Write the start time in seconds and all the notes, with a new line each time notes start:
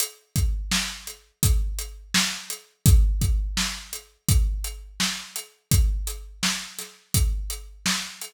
0.00 closed hi-hat
0.36 kick, closed hi-hat
0.71 snare
1.07 closed hi-hat
1.43 kick, closed hi-hat
1.79 closed hi-hat
2.14 snare
2.50 closed hi-hat
2.86 kick, closed hi-hat
3.21 kick, closed hi-hat
3.57 snare
3.93 closed hi-hat
4.29 kick, closed hi-hat
4.64 closed hi-hat
5.00 snare
5.36 closed hi-hat
5.71 kick, closed hi-hat
6.07 closed hi-hat
6.43 snare
6.79 snare, closed hi-hat
7.14 kick, closed hi-hat
7.50 closed hi-hat
7.86 snare
8.21 closed hi-hat